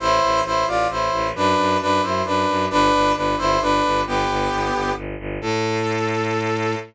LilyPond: <<
  \new Staff \with { instrumentName = "Brass Section" } { \time 3/4 \key a \minor \tempo 4 = 133 <e' c''>4 <e' c''>8 <f' d''>8 <e' c''>4 | <d' b'>4 <d' b'>8 <e' c''>8 <d' b'>4 | <d' b'>4 <d' b'>8 <e' c''>8 <d' b'>4 | <b g'>2 r4 |
a'2. | }
  \new Staff \with { instrumentName = "Violin" } { \clef bass \time 3/4 \key a \minor a,,8 a,,8 a,,8 a,,8 a,,8 a,,8 | fis,8 fis,8 fis,8 fis,8 fis,8 fis,8 | g,,8 g,,8 g,,8 g,,8 g,,8 g,,8 | g,,8 g,,8 g,,8 g,,8 g,,8 g,,8 |
a,2. | }
>>